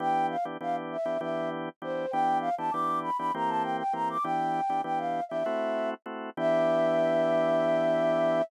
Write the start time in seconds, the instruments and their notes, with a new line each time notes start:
0.00 drawbar organ E3 B3 D4 G4, flute G5
0.30 flute F5
0.45 drawbar organ E3 B3 D4 G4
0.61 drawbar organ E3 B3 D4 G4, flute F5
0.92 flute E5
1.05 drawbar organ E3 B3 D4 G4
1.21 drawbar organ E3 B3 D4 G4, flute E5
1.82 drawbar organ E3 B3 D4 G4, flute C5
2.11 drawbar organ E3 B3 D4 G4, flute G5
2.40 flute F5
2.58 drawbar organ E3 B3 D4 G4, flute A5
2.71 drawbar organ E3 B3 D4 G4, flute D6
3.03 flute B5
3.18 drawbar organ E3 B3 D4 G4, flute B5
3.34 drawbar organ E3 A#3 C4 G4, flute A#5
3.48 flute A5
3.62 flute G5
3.79 flute G5
3.93 drawbar organ E3 A#3 C4 G4, flute A#5
4.09 flute D6
4.23 drawbar organ E3 B3 D4 G4, flute G5
4.69 drawbar organ E3 B3 D4 G4
4.84 drawbar organ E3 B3 D4 G4, flute G5
4.98 flute F5
5.29 drawbar organ E3 B3 D4 G4, flute E5
5.46 drawbar organ A3 C4 E4 F#4
6.06 drawbar organ A3 C4 E4 F#4
6.37 drawbar organ E3 B3 D4 G4, flute E5